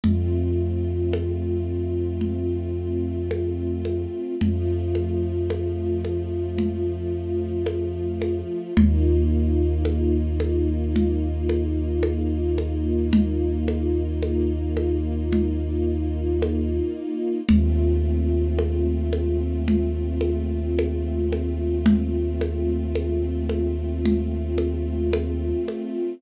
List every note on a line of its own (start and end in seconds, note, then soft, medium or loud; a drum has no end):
0.03 4.06 F2 medium
0.03 4.35 A3 medium
0.03 4.35 C4 medium
0.03 4.35 F4 medium
0.03 low conga medium
1.13 high conga medium
2.21 low conga medium
3.31 high conga medium
3.85 high conga medium
4.41 8.42 F2 medium
4.41 8.73 F3 medium
4.41 8.73 A3 medium
4.41 8.73 F4 medium
4.41 low conga medium
4.95 high conga medium
5.50 high conga medium
6.05 high conga medium
6.58 low conga medium
7.66 high conga medium
8.22 high conga medium
8.77 16.80 D#2 medium
8.77 17.41 A#3 medium
8.77 17.41 D#4 medium
8.77 17.41 F4 medium
8.77 low conga loud
9.85 high conga medium
10.40 high conga medium
10.96 low conga medium
11.49 high conga medium
12.03 high conga medium
12.58 high conga medium
13.13 low conga loud
13.68 high conga medium
14.22 high conga medium
14.77 high conga medium
15.32 low conga medium
16.42 high conga medium
17.49 25.53 D#2 medium
17.49 26.14 A3 medium
17.49 26.14 C4 medium
17.49 26.14 F4 medium
17.49 low conga loud
18.59 high conga medium
19.13 high conga medium
19.68 low conga medium
20.21 high conga medium
20.79 high conga medium
21.32 high conga medium
21.86 low conga loud
22.41 high conga medium
22.95 high conga medium
23.49 high conga medium
24.05 low conga medium
24.58 high conga medium
25.13 high conga medium
25.68 high conga medium